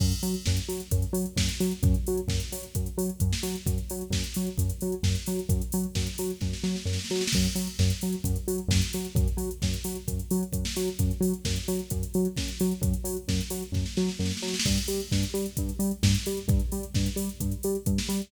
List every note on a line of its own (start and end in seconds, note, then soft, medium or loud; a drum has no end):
0.00 0.13 F#2 medium
0.00 kick medium
0.00 crash loud
0.12 closed hi-hat medium
0.23 0.35 F#3 medium
0.23 open hi-hat medium
0.34 closed hi-hat medium
0.46 0.59 F#2 medium
0.46 kick medium
0.46 snare medium
0.57 closed hi-hat medium
0.69 0.81 F#3 medium
0.69 open hi-hat medium
0.80 closed hi-hat medium
0.91 1.04 F#2 medium
0.91 kick medium
0.91 closed hi-hat loud
1.02 closed hi-hat medium
1.13 1.25 F#3 medium
1.13 open hi-hat medium
1.26 closed hi-hat medium
1.36 1.49 F#2 medium
1.36 kick medium
1.36 snare loud
1.49 closed hi-hat medium
1.60 1.73 F#3 medium
1.60 open hi-hat medium
1.71 closed hi-hat medium
1.83 1.95 F#2 loud
1.83 kick loud
1.83 closed hi-hat medium
1.94 closed hi-hat medium
2.06 2.20 F#3 medium
2.06 open hi-hat medium
2.17 closed hi-hat medium
2.28 2.40 F#2 medium
2.28 kick medium
2.28 snare medium
2.40 closed hi-hat medium
2.52 2.65 F#3 medium
2.52 open hi-hat medium
2.63 closed hi-hat medium
2.75 2.88 F#2 medium
2.75 kick medium
2.75 closed hi-hat medium
2.86 closed hi-hat medium
2.98 3.10 F#3 medium
2.98 open hi-hat medium
3.09 closed hi-hat medium
3.20 3.34 F#2 medium
3.20 kick medium
3.20 closed hi-hat loud
3.33 snare medium
3.43 3.56 F#3 medium
3.43 open hi-hat medium
3.55 closed hi-hat medium
3.66 3.79 F#2 medium
3.66 kick medium
3.66 closed hi-hat loud
3.78 closed hi-hat medium
3.90 4.03 F#3 medium
3.90 open hi-hat medium
4.01 closed hi-hat medium
4.10 4.23 F#2 medium
4.10 kick medium
4.10 snare medium
4.24 closed hi-hat medium
4.34 4.49 F#3 medium
4.34 open hi-hat medium
4.47 closed hi-hat medium
4.58 4.71 F#2 medium
4.58 kick medium
4.58 closed hi-hat loud
4.70 closed hi-hat medium
4.81 4.95 F#3 medium
4.81 open hi-hat medium
4.92 closed hi-hat medium
5.03 5.16 F#2 medium
5.03 kick medium
5.03 snare medium
5.15 closed hi-hat medium
5.26 5.40 F#3 medium
5.26 open hi-hat medium
5.39 closed hi-hat medium
5.49 5.62 F#2 medium
5.49 kick medium
5.49 closed hi-hat loud
5.62 closed hi-hat medium
5.72 5.86 F#3 medium
5.72 open hi-hat medium
5.83 closed hi-hat medium
5.95 6.08 F#2 medium
5.95 kick medium
5.95 snare medium
6.07 closed hi-hat medium
6.18 6.31 F#3 medium
6.18 open hi-hat medium
6.30 closed hi-hat medium
6.41 6.54 F#2 medium
6.41 kick medium
6.41 snare medium
6.53 snare medium
6.63 6.76 F#3 medium
6.63 snare medium
6.76 snare medium
6.85 6.98 F#2 medium
6.85 snare medium
6.93 snare medium
6.99 snare medium
7.04 snare medium
7.10 7.23 F#3 medium
7.10 snare medium
7.15 snare medium
7.21 snare medium
7.27 snare loud
7.32 7.47 F#2 medium
7.32 kick medium
7.32 crash loud
7.44 closed hi-hat medium
7.55 7.68 F#3 medium
7.55 open hi-hat medium
7.67 closed hi-hat medium
7.79 7.92 F#2 medium
7.79 kick medium
7.79 snare medium
7.90 closed hi-hat medium
8.01 8.15 F#3 medium
8.01 open hi-hat medium
8.12 closed hi-hat medium
8.24 8.37 F#2 medium
8.24 kick medium
8.24 closed hi-hat loud
8.36 closed hi-hat medium
8.48 8.60 F#3 medium
8.48 open hi-hat medium
8.58 closed hi-hat medium
8.68 8.81 F#2 medium
8.68 kick medium
8.68 snare loud
8.82 closed hi-hat medium
8.93 9.07 F#3 medium
8.93 open hi-hat medium
9.05 closed hi-hat medium
9.15 9.28 F#2 loud
9.15 kick loud
9.15 closed hi-hat medium
9.28 closed hi-hat medium
9.37 9.50 F#3 medium
9.37 open hi-hat medium
9.51 closed hi-hat medium
9.62 9.75 F#2 medium
9.62 kick medium
9.62 snare medium
9.73 closed hi-hat medium
9.84 9.97 F#3 medium
9.84 open hi-hat medium
9.95 closed hi-hat medium
10.08 10.20 F#2 medium
10.08 kick medium
10.08 closed hi-hat medium
10.19 closed hi-hat medium
10.31 10.44 F#3 medium
10.31 open hi-hat medium
10.43 closed hi-hat medium
10.52 10.65 F#2 medium
10.52 kick medium
10.52 closed hi-hat loud
10.65 snare medium
10.76 10.89 F#3 medium
10.76 open hi-hat medium
10.88 closed hi-hat medium
10.99 11.12 F#2 medium
10.99 kick medium
10.99 closed hi-hat loud
11.11 closed hi-hat medium
11.21 11.33 F#3 medium
11.21 open hi-hat medium
11.33 closed hi-hat medium
11.45 11.58 F#2 medium
11.45 kick medium
11.45 snare medium
11.56 closed hi-hat medium
11.68 11.81 F#3 medium
11.68 open hi-hat medium
11.79 closed hi-hat medium
11.90 12.04 F#2 medium
11.90 kick medium
11.90 closed hi-hat loud
12.03 closed hi-hat medium
12.14 12.27 F#3 medium
12.14 open hi-hat medium
12.25 closed hi-hat medium
12.37 12.50 F#2 medium
12.37 kick medium
12.37 snare medium
12.48 closed hi-hat medium
12.60 12.73 F#3 medium
12.60 open hi-hat medium
12.71 closed hi-hat medium
12.81 12.94 F#2 medium
12.81 kick medium
12.81 closed hi-hat loud
12.94 closed hi-hat medium
13.04 13.17 F#3 medium
13.04 open hi-hat medium
13.17 closed hi-hat medium
13.28 13.41 F#2 medium
13.28 kick medium
13.28 snare medium
13.41 closed hi-hat medium
13.50 13.63 F#3 medium
13.50 open hi-hat medium
13.62 closed hi-hat medium
13.72 13.85 F#2 medium
13.72 kick medium
13.72 snare medium
13.86 snare medium
13.97 14.10 F#3 medium
13.97 snare medium
14.09 snare medium
14.19 14.32 F#2 medium
14.19 snare medium
14.26 snare medium
14.31 snare medium
14.37 snare medium
14.42 14.55 F#3 medium
14.42 snare medium
14.48 snare medium
14.54 snare medium
14.60 snare loud
14.65 14.78 G2 medium
14.65 kick medium
14.65 crash loud
14.78 closed hi-hat medium
14.88 15.01 G3 medium
14.88 open hi-hat medium
15.00 closed hi-hat medium
15.11 15.24 G2 medium
15.11 kick medium
15.11 snare medium
15.23 closed hi-hat medium
15.34 15.46 G3 medium
15.34 open hi-hat medium
15.46 closed hi-hat medium
15.57 15.71 G2 medium
15.57 kick medium
15.57 closed hi-hat loud
15.69 closed hi-hat medium
15.79 15.92 G3 medium
15.79 open hi-hat medium
15.91 closed hi-hat medium
16.03 16.15 G2 medium
16.03 kick medium
16.03 snare loud
16.15 closed hi-hat medium
16.26 16.39 G3 medium
16.26 open hi-hat medium
16.37 closed hi-hat medium
16.48 16.60 G2 loud
16.48 kick loud
16.48 closed hi-hat medium
16.60 closed hi-hat medium
16.72 16.85 G3 medium
16.72 open hi-hat medium
16.83 closed hi-hat medium
16.94 17.08 G2 medium
16.94 kick medium
16.94 snare medium
17.06 closed hi-hat medium
17.16 17.29 G3 medium
17.16 open hi-hat medium
17.29 closed hi-hat medium
17.40 17.54 G2 medium
17.40 kick medium
17.40 closed hi-hat medium
17.52 closed hi-hat medium
17.63 17.77 G3 medium
17.63 open hi-hat medium
17.75 closed hi-hat medium
17.86 17.99 G2 medium
17.86 kick medium
17.86 closed hi-hat loud
17.98 snare medium
18.09 18.21 G3 medium
18.09 open hi-hat medium
18.21 closed hi-hat medium